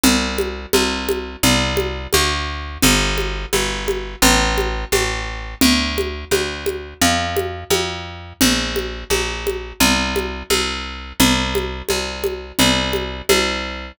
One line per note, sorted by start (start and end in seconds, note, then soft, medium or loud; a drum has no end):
0.03 0.66 C2 medium
0.03 low conga medium
0.38 high conga medium
0.73 1.36 C2 medium
0.73 high conga medium
1.09 high conga medium
1.43 2.07 C2 medium
1.43 low conga medium
1.77 high conga medium
2.13 2.78 D2 medium
2.13 high conga medium
2.82 3.46 G1 medium
2.82 low conga medium
3.18 high conga medium
3.53 4.16 G1 medium
3.53 high conga medium
3.88 high conga medium
4.22 4.85 A1 medium
4.22 low conga medium
4.58 high conga medium
4.92 5.55 A1 medium
4.92 high conga medium
5.61 6.25 D2 medium
5.61 low conga loud
5.98 high conga medium
6.31 6.94 D2 medium
6.31 high conga medium
6.66 high conga medium
7.01 7.64 F2 medium
7.01 low conga medium
7.36 high conga medium
7.70 8.33 F2 medium
7.70 high conga medium
8.41 9.04 A#1 medium
8.41 low conga medium
8.76 high conga medium
9.10 9.73 A#1 medium
9.10 high conga medium
9.47 high conga medium
9.80 10.43 C2 medium
9.80 low conga medium
10.16 high conga medium
10.50 11.13 C2 medium
10.50 high conga medium
11.20 11.82 C2 medium
11.20 low conga medium
11.55 high conga medium
11.89 12.52 C2 medium
11.89 high conga medium
12.24 high conga medium
12.59 13.22 C2 medium
12.59 low conga medium
12.93 high conga medium
13.29 13.92 C2 medium
13.29 high conga medium